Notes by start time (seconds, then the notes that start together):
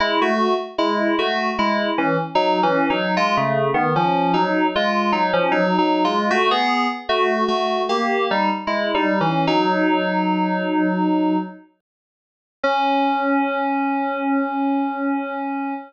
0.00 G#3 E4
0.22 A3 F#4
0.78 G#3 E4
1.19 A3 F#4
1.59 G#3 E4
1.98 E3 C#4
2.35 F#3 D#4
2.63 E3 C#4
2.90 F#3 D#4
3.17 G#3 F4
3.37 C#3 A3
3.74 D#3 B3
3.96 F3 C#4
4.34 F#3 D#4
4.75 G#3 F4
5.12 F#3 D#4
5.33 F3 C#4
5.51 F#3 D#4
5.78 F#3 D#4
6.04 G#3 F4
6.30 A3 F#4
6.51 B3 G#4
7.09 A3 F#4
7.48 A3 F#4
7.89 A#3 G4
8.31 G3 D#4
8.67 G#3 E4
8.94 G3 D#4
9.21 E3 C#4
9.47 F#3 D#4
12.63 C#4